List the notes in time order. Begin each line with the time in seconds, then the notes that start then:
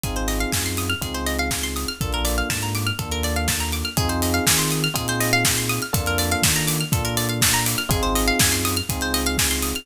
0.03 G#1 C4 D#4 F4 G#4, kick, closed hi-hat
0.16 C5, closed hi-hat
0.28 D#5, open hi-hat
0.40 F5, closed hi-hat
0.52 F#2 G#5, kick, snare
0.66 C6, closed hi-hat
0.77 D#6, open hi-hat
0.90 F6, closed hi-hat
1.01 C#2 C4 D#4 F4 G#4, kick, closed hi-hat
1.14 C5, closed hi-hat
1.26 D#5, open hi-hat
1.39 F5, closed hi-hat
1.51 G#5, kick, snare
1.63 C6, closed hi-hat
1.76 D#6, open hi-hat
1.88 F6, closed hi-hat
2.01 A#1 A#3 D4 F4 A4, kick, closed hi-hat
2.13 A#4, closed hi-hat
2.25 D5, open hi-hat
2.38 F5, closed hi-hat
2.50 G#2 A5, kick, snare
2.62 A#5, closed hi-hat
2.75 D6, open hi-hat
2.87 F6, closed hi-hat
2.99 D#2 A#3 D4 F4 A4, kick, closed hi-hat
3.11 A#4, closed hi-hat
3.23 D5, open hi-hat
3.36 F5, closed hi-hat
3.48 A5, kick, snare
3.60 A#5, closed hi-hat
3.72 D6, open hi-hat
3.85 F6, closed hi-hat
3.97 F2 C4 D#4 F4 G#4, kick, closed hi-hat
4.09 C5, closed hi-hat
4.22 D#5, open hi-hat
4.34 F5, closed hi-hat
4.47 D#3 G#5, kick, snare
4.59 C6, closed hi-hat
4.71 D#6, open hi-hat
4.84 F6, closed hi-hat
4.94 A#2 C4 D#4 F4 G#4, kick, closed hi-hat
5.08 C5, closed hi-hat
5.20 D#5, open hi-hat
5.33 F5, closed hi-hat
5.45 G#5, kick, snare
5.57 C6, closed hi-hat
5.69 D#6, open hi-hat
5.82 F6, closed hi-hat
5.93 F2 A#3 D4 F4 A4, kick, closed hi-hat
6.06 A#4, closed hi-hat
6.18 D5, open hi-hat
6.31 F5, closed hi-hat
6.42 D#3 A5, kick, snare
6.56 A#5, closed hi-hat
6.68 D6, open hi-hat
6.80 F6, closed hi-hat
6.92 A#2 A#3 D4 F4 A4, kick, closed hi-hat
7.05 A#4, closed hi-hat
7.17 D5, open hi-hat
7.29 F5, closed hi-hat
7.41 A5, kick, snare
7.54 A#5, closed hi-hat
7.66 D6, open hi-hat
7.78 F6, closed hi-hat
7.89 G#1 C4 D#4 F4 G#4, kick, closed hi-hat
8.03 C5, closed hi-hat
8.15 D#5, open hi-hat
8.28 F5, closed hi-hat
8.39 F#2 G#5, kick, snare
8.52 C6, closed hi-hat
8.65 D#6, open hi-hat
8.77 F6, closed hi-hat
8.89 C#2 C4 D#4 F4 G#4, kick, closed hi-hat
9.01 C5, closed hi-hat
9.14 D#5, open hi-hat
9.26 F5, closed hi-hat
9.38 G#5, kick, snare
9.51 C6, closed hi-hat
9.62 D#6, open hi-hat
9.75 F6, closed hi-hat